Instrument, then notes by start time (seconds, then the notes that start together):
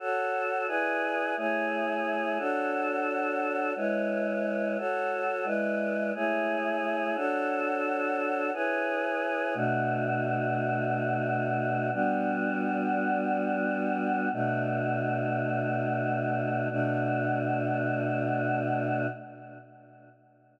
choir aahs
0.00 F#4 A4 C#5
0.67 E4 G#4 B4 D5
1.37 A3 E4 G#4 C#5
2.38 D4 F#4 A4 C#5
3.76 G#3 E4 B4 C#5
4.78 F#4 A4 C#5
5.44 G#3 E4 B4 D5
6.15 A3 E4 G#4 C#5
7.16 D4 F#4 A4 C#5
8.53 E4 G#4 B4 C#5
9.54 B2 A3 D4 F#4
11.93 G3 B3 D4 F#4
14.32 B2 A3 D4 F#4
16.70 B2 A3 D4 F#4